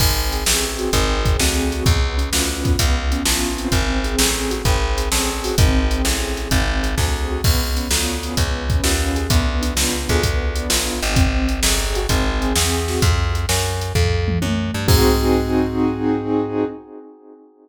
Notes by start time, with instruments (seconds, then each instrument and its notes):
0.00 electric bass (finger) G#1, acoustic grand piano C4, kick, crash
0.32 acoustic grand piano G#4, closed hi-hat
0.46 electric bass (finger) A1, acoustic grand piano C4, snare
0.78 acoustic grand piano F#4, closed hi-hat
0.93 electric bass (finger) G#1, acoustic grand piano C4, kick, closed hi-hat
1.25 acoustic grand piano G#4, kick, closed hi-hat
1.40 electric bass (finger) D2, acoustic grand piano C4, snare
1.72 acoustic grand piano F#4, closed hi-hat
1.86 electric bass (finger) C#2, acoustic grand piano B3, kick, closed hi-hat
2.18 acoustic grand piano C#4, closed hi-hat
2.33 electric bass (finger) D2, acoustic grand piano F4, snare
2.64 acoustic grand piano B3, kick, closed hi-hat
2.79 electric bass (finger) C#2, kick, closed hi-hat
3.11 acoustic grand piano C#4, closed hi-hat
3.25 electric bass (finger) A1, acoustic grand piano F4, snare
3.57 acoustic grand piano C4, closed hi-hat
3.72 electric bass (finger) G#1, kick, closed hi-hat
4.04 acoustic grand piano G#4, closed hi-hat
4.19 electric bass (finger) A1, acoustic grand piano C4, snare
4.51 acoustic grand piano F#4, closed hi-hat
4.65 electric bass (finger) G#1, acoustic grand piano C4, kick, closed hi-hat
4.98 acoustic grand piano G#4, closed hi-hat
5.11 electric bass (finger) A1, acoustic grand piano C4, snare
5.44 acoustic grand piano F#4, open hi-hat
5.58 electric bass (finger) G#1, acoustic grand piano C4, kick, closed hi-hat
5.91 acoustic grand piano G#4, closed hi-hat
6.05 electric bass (finger) A1, acoustic grand piano C4, snare
6.37 acoustic grand piano F#4, closed hi-hat
6.51 electric bass (finger) G#1, acoustic grand piano C4, kick, closed hi-hat
6.83 acoustic grand piano G#4, closed hi-hat
6.97 electric bass (finger) D2, acoustic grand piano C4, kick, snare
7.30 acoustic grand piano F#4
7.44 electric bass (finger) C#2, acoustic grand piano B3, kick, crash
7.76 acoustic grand piano C#4, closed hi-hat
7.91 electric bass (finger) D2, acoustic grand piano F4, snare
8.22 acoustic grand piano G#4, closed hi-hat
8.37 electric bass (finger) C#2, acoustic grand piano B3, kick, closed hi-hat
8.69 acoustic grand piano C#4, kick, closed hi-hat
8.84 electric bass (finger) D#2, acoustic grand piano F4, snare
9.16 acoustic grand piano G#4, closed hi-hat
9.30 electric bass (finger) D2, acoustic grand piano B3, kick, closed hi-hat
9.62 acoustic grand piano D4, closed hi-hat
9.76 electric bass (finger) C#2, acoustic grand piano F4, snare
10.09 electric bass (finger) D2, acoustic grand piano G#4, kick, closed hi-hat
10.23 acoustic grand piano B3, kick, closed hi-hat
10.56 acoustic grand piano D4, closed hi-hat
10.70 electric bass (finger) A1, acoustic grand piano F4, snare
11.02 electric bass (finger) G#1, acoustic grand piano G#4, closed hi-hat
11.16 acoustic grand piano C4, kick, closed hi-hat
11.49 acoustic grand piano G#4, closed hi-hat
11.62 electric bass (finger) G1, acoustic grand piano C4, snare
11.95 acoustic grand piano F#4, closed hi-hat
12.09 electric bass (finger) G#1, acoustic grand piano C4, kick, closed hi-hat
12.41 acoustic grand piano G#4, closed hi-hat
12.56 electric bass (finger) E2, acoustic grand piano C4, snare
12.88 acoustic grand piano F#4, snare
13.02 electric bass (finger) F2, kick, closed hi-hat
13.35 closed hi-hat
13.49 electric bass (finger) F#2, snare
13.81 closed hi-hat
13.95 electric bass (finger) F2, kick, floor tom
14.28 mid tom
14.42 electric bass (finger) F#2, high tom
14.74 electric bass (finger) G2
14.88 electric bass (finger) G#2, acoustic grand piano C4 D#4 F#4 G#4, kick, crash